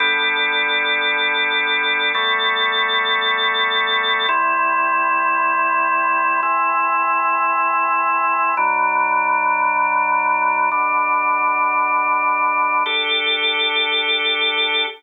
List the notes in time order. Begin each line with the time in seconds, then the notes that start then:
0.00 G3 B3 D4 A4
2.14 G3 A3 B3 A4
4.29 C3 G3 E4
6.43 C3 E3 E4
8.57 B2 F#3 D4
10.71 B2 D3 D4
12.86 D4 G4 A4